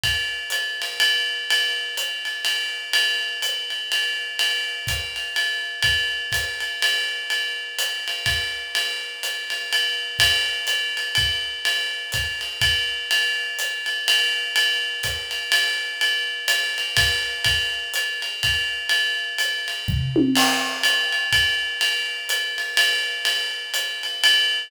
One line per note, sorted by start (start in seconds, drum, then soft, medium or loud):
0.04 kick medium
0.04 ride medium
0.50 hi-hat pedal medium
0.50 ride medium
0.82 ride medium
1.00 ride medium
1.50 ride medium
1.97 hi-hat pedal medium
1.97 ride medium
2.25 ride medium
2.45 ride medium
2.93 ride loud
3.42 hi-hat pedal medium
3.42 ride medium
3.70 ride medium
3.92 ride medium
4.39 ride medium
4.87 kick medium
4.87 hi-hat pedal medium
4.87 ride medium
5.16 ride medium
5.36 ride medium
5.82 kick medium
5.82 ride medium
6.32 kick soft
6.32 hi-hat pedal medium
6.32 ride medium
6.60 ride medium
6.82 ride medium
7.30 ride medium
7.79 hi-hat pedal medium
7.79 ride medium
8.08 ride medium
8.26 kick medium
8.26 ride medium
8.75 ride medium
9.23 hi-hat pedal medium
9.23 ride medium
9.50 ride medium
9.73 ride medium
10.19 kick medium
10.19 ride loud
10.67 hi-hat pedal medium
10.67 ride medium
10.97 ride medium
11.15 kick medium
11.15 ride medium
11.65 ride medium
12.12 kick medium
12.12 hi-hat pedal medium
12.12 ride medium
12.41 ride medium
12.61 kick medium
12.61 ride medium
13.11 ride medium
13.59 hi-hat pedal medium
13.59 ride medium
13.86 ride medium
14.08 ride loud
14.56 ride medium
15.03 kick soft
15.03 hi-hat pedal medium
15.03 ride medium
15.31 ride medium
15.52 ride loud
16.01 ride medium
16.48 hi-hat pedal medium
16.48 ride medium
16.78 ride medium
16.97 kick medium
16.97 ride loud
17.44 kick medium
17.44 ride medium
17.94 hi-hat pedal medium
17.94 ride medium
18.22 ride medium
18.43 kick medium
18.43 ride medium
18.89 ride medium
19.38 hi-hat pedal medium
19.38 ride medium
19.68 ride medium
19.88 kick medium
19.88 floor tom medium
20.16 high tom loud
20.35 crash loud
20.35 ride medium
20.83 hi-hat pedal medium
20.83 ride medium
21.12 ride medium
21.33 kick medium
21.33 ride medium
21.81 ride medium
22.29 hi-hat pedal medium
22.29 ride medium
22.58 ride medium
22.77 ride loud
23.25 ride medium
23.74 hi-hat pedal medium
23.74 ride medium
24.03 ride medium
24.24 ride loud